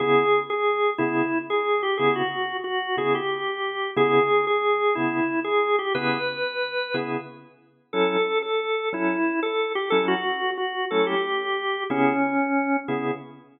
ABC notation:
X:1
M:12/8
L:1/8
Q:3/8=121
K:C#m
V:1 name="Drawbar Organ"
G3 G3 E3 G2 =G | G F3 F2 G =G5 | G3 G3 E3 G2 =G | B7 z5 |
A3 A3 E3 A2 =G | A F3 F2 A =G5 | C6 z6 |]
V:2 name="Drawbar Organ"
[C,B,E]6 [C,B,G]6 | [C,B,E]6 [C,B,E]6 | [C,B,E]6 [C,B,G]6 | [C,B,EG]6 [C,B,EG]6 |
[F,CE]6 [F,CA]6 | [F,CE]6 [F,A,CE]6 | [C,B,EG]6 [C,B,EG]6 |]